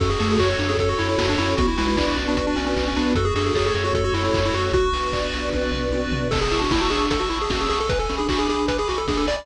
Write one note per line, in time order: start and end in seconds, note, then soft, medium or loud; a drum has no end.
0.00 0.16 F#2 loud
0.00 1.56 C#4 medium
0.00 0.10 C#4 medium
0.00 0.58 F#4 loud
0.00 1.56 F#4 medium
0.00 1.56 A4 medium
0.00 0.09 A4 medium
0.00 kick loud
0.00 crash medium
0.10 0.19 G#4 medium
0.19 0.37 F#2 medium
0.19 0.37 A3 medium
0.19 0.29 G#4 medium
0.19 0.79 A4 medium
0.19 open hi-hat medium
0.30 0.40 G#4 medium
0.38 0.55 F#2 medium
0.38 0.49 F#4 medium
0.38 0.57 F#4 medium
0.38 0.98 C#5 medium
0.38 kick medium
0.38 clap loud
0.50 0.59 F#4 medium
0.58 0.75 F#2 medium
0.58 0.68 D4 medium
0.58 1.17 F#4 medium
0.58 open hi-hat medium
0.69 0.79 C#4 medium
0.69 0.78 G#4 medium
0.77 0.94 F#2 medium
0.77 1.37 A4 medium
0.77 0.89 A4 medium
0.77 kick medium
0.77 closed hi-hat loud
0.89 0.98 F#4 medium
0.98 1.16 F#2 medium
0.98 1.08 E4 medium
0.98 1.55 C#5 medium
0.98 open hi-hat medium
1.09 1.26 E4 medium
1.17 1.36 F#2 medium
1.17 1.55 F#4 medium
1.17 kick medium
1.17 snare loud
1.29 1.39 D4 medium
1.38 1.55 F#2 medium
1.38 1.57 C#4 medium
1.38 1.55 E4 medium
1.38 1.56 A4 medium
1.38 open hi-hat medium
1.57 1.75 B1 loud
1.57 3.14 B3 medium
1.57 1.68 B3 medium
1.57 3.14 D4 medium
1.57 2.17 F#4 loud
1.57 1.67 F#4 medium
1.57 3.14 F#4 medium
1.57 kick loud
1.57 closed hi-hat loud
1.68 1.77 E4 medium
1.77 1.95 B1 medium
1.77 1.95 G#3 medium
1.77 1.87 E4 medium
1.77 2.35 B4 medium
1.77 open hi-hat medium
1.88 1.97 E4 medium
1.96 2.13 B1 medium
1.96 2.16 D4 medium
1.96 2.06 E4 medium
1.96 2.56 D5 medium
1.96 kick medium
1.96 clap loud
2.08 2.17 E4 medium
2.17 2.34 B1 medium
2.17 2.26 C#4 medium
2.17 2.76 F#4 medium
2.17 open hi-hat medium
2.27 2.37 B3 medium
2.27 2.37 D4 medium
2.35 2.54 B1 medium
2.35 2.46 F#4 medium
2.35 2.95 B4 medium
2.35 kick medium
2.35 closed hi-hat loud
2.47 2.56 D4 medium
2.56 2.74 B1 medium
2.56 2.65 C#4 medium
2.56 3.13 D5 medium
2.56 open hi-hat medium
2.67 2.85 C#4 medium
2.76 2.93 B1 loud
2.76 3.14 F#4 medium
2.76 kick medium
2.76 clap medium
2.88 2.97 C#4 medium
2.96 3.13 B1 medium
2.96 3.14 B3 medium
2.96 3.13 D4 medium
2.96 3.15 B4 medium
2.96 open hi-hat medium
3.15 3.32 F#2 loud
3.15 4.72 A3 medium
3.15 4.72 C#4 medium
3.15 3.73 F#4 loud
3.15 4.72 F#4 medium
3.15 3.26 F#4 medium
3.15 3.25 A4 medium
3.15 kick medium
3.15 closed hi-hat loud
3.25 3.34 G#4 medium
3.35 3.51 F#2 loud
3.35 3.52 D4 medium
3.35 3.45 G#4 medium
3.35 3.94 A4 medium
3.35 open hi-hat medium
3.46 3.55 G#4 medium
3.54 3.71 F#2 medium
3.54 3.66 G#4 medium
3.54 3.72 A4 medium
3.54 4.15 C#5 medium
3.54 kick medium
3.54 clap loud
3.66 3.75 G#4 medium
3.73 3.91 F#2 medium
3.73 4.33 F#4 medium
3.73 3.85 G#4 medium
3.73 open hi-hat medium
3.84 3.94 F#4 medium
3.93 4.10 F#2 medium
3.93 4.54 A4 medium
3.93 4.04 A4 medium
3.93 kick medium
3.93 closed hi-hat medium
4.04 4.14 F#4 medium
4.13 4.30 F#2 medium
4.13 4.23 E4 medium
4.13 4.72 C#5 medium
4.13 open hi-hat medium
4.24 4.40 E4 medium
4.33 4.50 F#2 medium
4.33 4.71 F#4 medium
4.33 kick medium
4.33 clap loud
4.45 4.55 E4 medium
4.54 4.70 F#2 medium
4.54 4.70 F#4 medium
4.54 4.73 F#4 medium
4.54 4.73 A4 medium
4.54 open hi-hat medium
4.72 4.89 B1 loud
4.72 6.30 B3 medium
4.72 6.30 D4 medium
4.72 5.61 F#4 medium
4.72 6.30 F#4 medium
4.72 5.50 F#4 medium
4.72 5.33 F#4 loud
4.72 kick loud
4.72 closed hi-hat medium
4.92 5.09 B1 medium
4.92 5.54 B4 medium
4.92 open hi-hat medium
5.13 5.31 B1 medium
5.13 5.71 D5 medium
5.13 kick medium
5.13 clap medium
5.33 5.50 B1 medium
5.33 5.93 F#4 medium
5.33 open hi-hat medium
5.52 5.71 B1 loud
5.52 6.13 B4 loud
5.52 kick medium
5.52 high tom medium
5.72 5.89 B1 loud
5.72 6.28 D5 medium
5.72 floor tom medium
5.91 6.07 B1 medium
5.91 6.31 F#4 medium
5.91 high tom medium
6.11 6.28 B1 medium
6.11 6.32 B4 medium
6.11 floor tom loud
6.31 6.47 A1 medium
6.31 6.40 A4 medium
6.31 7.10 A5 medium
6.31 kick loud
6.31 crash loud
6.41 6.60 G#4 medium
6.41 closed hi-hat medium
6.51 6.68 A1 medium
6.51 6.61 E4 medium
6.51 6.91 C#6 medium
6.51 open hi-hat medium
6.61 6.71 D4 medium
6.61 6.71 F#4 medium
6.61 closed hi-hat medium
6.70 6.87 A1 medium
6.70 6.81 E4 medium
6.70 6.89 E4 medium
6.70 7.49 E6 medium
6.70 kick medium
6.70 snare loud
6.81 6.90 F#4 medium
6.81 closed hi-hat medium
6.90 7.07 A1 medium
6.90 7.19 D4 medium
6.90 7.06 G#4 medium
6.90 7.29 C#6 medium
6.90 open hi-hat medium
7.01 closed hi-hat medium
7.10 7.27 A1 medium
7.10 7.20 A4 medium
7.10 7.86 A5 medium
7.10 kick medium
7.10 closed hi-hat loud
7.20 7.29 F#4 medium
7.20 closed hi-hat medium
7.29 7.47 A1 medium
7.29 7.39 E4 medium
7.29 7.69 C#6 medium
7.29 open hi-hat medium
7.40 7.51 G#4 medium
7.40 closed hi-hat medium
7.49 7.66 A1 medium
7.49 7.67 C#4 medium
7.49 7.60 F#4 medium
7.49 7.87 E6 medium
7.49 kick medium
7.49 snare loud
7.60 7.69 G#4 medium
7.60 closed hi-hat medium
7.69 8.06 B1 medium
7.69 7.79 G#4 medium
7.69 7.88 C#6 medium
7.69 open hi-hat medium
7.80 7.90 A4 medium
7.80 closed hi-hat medium
7.89 7.99 B4 medium
7.89 8.68 G#5 medium
7.89 kick loud
7.89 closed hi-hat loud
7.99 8.15 A4 medium
7.99 closed hi-hat medium
8.09 8.27 B1 medium
8.09 8.19 C#4 medium
8.09 8.47 B5 medium
8.09 open hi-hat medium
8.18 8.28 D4 medium
8.18 8.28 G#4 medium
8.18 closed hi-hat medium
8.28 8.46 B1 medium
8.28 8.47 D4 medium
8.28 8.39 F#4 medium
8.28 9.09 D6 medium
8.28 kick medium
8.28 clap loud
8.38 8.48 G#4 medium
8.38 closed hi-hat medium
8.47 8.66 B1 medium
8.47 8.78 D4 medium
8.47 8.66 G#4 medium
8.47 8.88 B5 medium
8.47 open hi-hat medium
8.59 closed hi-hat medium
8.68 8.84 B1 medium
8.68 8.77 B4 medium
8.68 9.44 G#5 medium
8.68 kick medium
8.68 closed hi-hat loud
8.78 8.88 G#4 medium
8.78 closed hi-hat medium
8.88 9.06 B1 medium
8.88 8.98 F#4 medium
8.88 9.27 B5 medium
8.88 open hi-hat medium
8.98 9.07 A4 medium
8.98 closed hi-hat medium
9.07 9.24 B1 medium
9.07 9.25 D4 medium
9.07 9.18 G#4 medium
9.07 9.46 D6 medium
9.07 kick medium
9.07 snare medium
9.17 9.27 A4 medium
9.17 closed hi-hat medium
9.27 9.44 B1 medium
9.27 9.36 D5 medium
9.27 9.46 B5 medium
9.27 open hi-hat medium
9.37 9.46 D5 medium
9.37 closed hi-hat medium